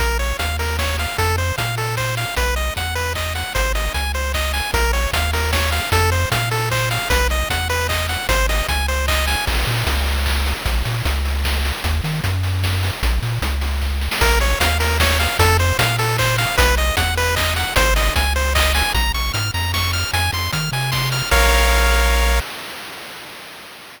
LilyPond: <<
  \new Staff \with { instrumentName = "Lead 1 (square)" } { \time 3/4 \key bes \minor \tempo 4 = 152 bes'8 des''8 f''8 bes'8 des''8 f''8 | a'8 c''8 f''8 a'8 c''8 f''8 | ces''8 ees''8 ges''8 ces''8 ees''8 ges''8 | c''8 ees''8 aes''8 c''8 ees''8 aes''8 |
bes'8 des''8 f''8 bes'8 des''8 f''8 | a'8 c''8 f''8 a'8 c''8 f''8 | ces''8 ees''8 ges''8 ces''8 ees''8 ges''8 | c''8 ees''8 aes''8 c''8 ees''8 aes''8 |
r2. | r2. | r2. | r2. |
bes'8 des''8 f''8 bes'8 des''8 f''8 | a'8 c''8 f''8 a'8 c''8 f''8 | ces''8 ees''8 ges''8 ces''8 ees''8 ges''8 | c''8 ees''8 aes''8 c''8 ees''8 aes''8 |
bes''8 des'''8 f'''8 bes''8 des'''8 f'''8 | aes''8 c'''8 f'''8 aes''8 c'''8 f'''8 | <bes' des'' f''>2. | }
  \new Staff \with { instrumentName = "Synth Bass 1" } { \clef bass \time 3/4 \key bes \minor bes,,4 ees,2 | f,4 bes,2 | ces,4 e,2 | aes,,4 des,2 |
bes,,4 ees,2 | f,4 bes,2 | ces,4 e,2 | aes,,4 des,2 |
bes,,8 bes,8 des,2 | bes,,8 bes,8 des,2 | ees,8 ees8 ges,2 | bes,,8 bes,8 des,2 |
bes,,4 ees,2 | f,4 bes,2 | ces,4 e,2 | aes,,4 des,2 |
bes,,8 bes,,8 aes,8 f,4. | f,8 f,8 ees8 c4. | bes,,2. | }
  \new DrumStaff \with { instrumentName = "Drums" } \drummode { \time 3/4 <hh bd>8 hho8 <hh bd>8 hho8 <bd sn>8 hho8 | <hh bd>8 hho8 <hh bd>8 hho8 <hc bd>8 hho8 | <hh bd>8 hho8 <hh bd>8 hho8 <hc bd>8 hho8 | <hh bd>8 hho8 <hh bd>8 hho8 <hc bd>8 hho8 |
<hh bd>8 hho8 <hh bd>8 hho8 <bd sn>8 hho8 | <hh bd>8 hho8 <hh bd>8 hho8 <hc bd>8 hho8 | <hh bd>8 hho8 <hh bd>8 hho8 <hc bd>8 hho8 | <hh bd>8 hho8 <hh bd>8 hho8 <hc bd>8 hho8 |
<cymc bd>8 hho8 <hh bd>8 hho8 <hc bd>8 hho8 | <hh bd>8 hho8 <hh bd>8 hho8 <bd sn>8 hho8 | <hh bd>8 hho8 <hh bd>8 hho8 <bd sn>8 hho8 | <hh bd>8 hho8 <hh bd>8 hho8 <bd sn>8 sn16 sn16 |
<hh bd>8 hho8 <hh bd>8 hho8 <bd sn>8 hho8 | <hh bd>8 hho8 <hh bd>8 hho8 <hc bd>8 hho8 | <hh bd>8 hho8 <hh bd>8 hho8 <hc bd>8 hho8 | <hh bd>8 hho8 <hh bd>8 hho8 <hc bd>8 hho8 |
<hh bd>8 hho8 hh8 hho8 <bd sn>8 hho8 | hh8 hho8 <hh bd>8 hho8 <bd sn>8 hho8 | <cymc bd>4 r4 r4 | }
>>